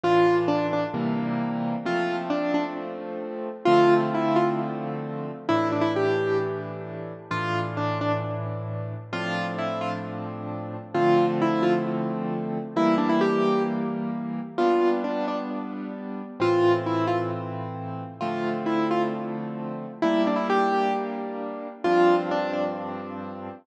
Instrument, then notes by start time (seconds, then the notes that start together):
acoustic grand piano
0.04 A2 E3 D4 F4
0.48 D4
0.73 D4
0.94 C3 E3 G3 A#3
1.86 F3 A3 C4 F4
2.30 D4
2.54 D4
3.65 D3 F3 A3 C4 F4
4.14 E4
4.36 F4
5.49 A2 E3 D4 E4
5.72 D4
5.81 E4
5.96 G4
7.31 A2 E3 D4 F4
7.77 D4
8.01 D4
9.13 A2 F3 C4 D4 F4
9.58 E4
9.81 F4
10.94 D3 F3 A3 C4 F4
11.42 E4
11.63 F4
12.76 E3 G3 A#3 E4
12.98 D4
13.09 E4
13.21 G4
14.58 G3 B3 D4 F4
15.04 D4
15.28 D4
16.40 A2 E3 C4 F4
16.86 E4
17.07 F4
18.21 D3 F3 A3 C4 F4
18.66 E4
18.91 F4
20.02 G3 A#3 D4 E4
20.27 D4
20.36 E4
20.50 G4
21.84 G2 F3 C4 D4 F4
22.31 D4
22.53 D4